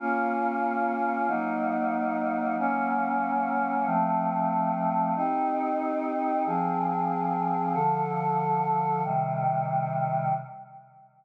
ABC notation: X:1
M:6/8
L:1/8
Q:3/8=93
K:Bbm
V:1 name="Choir Aahs"
[B,DF]6 | [G,B,E]6 | [G,B,D]6 | [F,=A,C]6 |
[K:Cm] [CEG]6 | [F,CA]6 | [D,F,=A]6 | [C,E,G,]6 |]